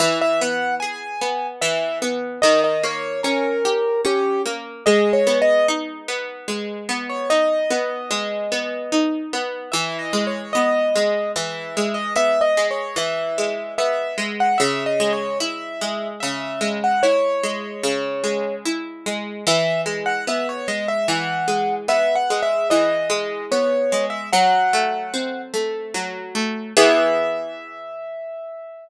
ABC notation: X:1
M:3/4
L:1/16
Q:1/4=74
K:E
V:1 name="Acoustic Grand Piano"
e e f2 g4 e2 z2 | d d c2 ^A4 =G2 z2 | (3d2 c2 d2 z7 c | d10 z2 |
(3e2 d2 c2 d4 e3 d | (3e2 d2 c2 e4 e3 f | (3e2 d2 c2 e4 e3 f | c8 z4 |
e2 z f e c d e f4 | (3e2 f2 e2 d4 c3 e | f6 z6 | e12 |]
V:2 name="Harpsichord"
E,2 B,2 G2 B,2 E,2 B,2 | D,2 ^A,2 C2 =G2 C2 A,2 | G,2 B,2 D2 B,2 G,2 B,2 | D2 B,2 G,2 B,2 D2 B,2 |
E,2 G,2 B,2 G,2 E,2 G,2 | B,2 G,2 E,2 G,2 B,2 G,2 | C,2 G,2 E2 G,2 C,2 G,2 | E2 G,2 C,2 G,2 E2 G,2 |
E,2 G,2 B,2 G,2 E,2 G,2 | B,2 G,2 E,2 G,2 B,2 G,2 | F,2 A,2 =C2 A,2 F,2 A,2 | [E,B,G]12 |]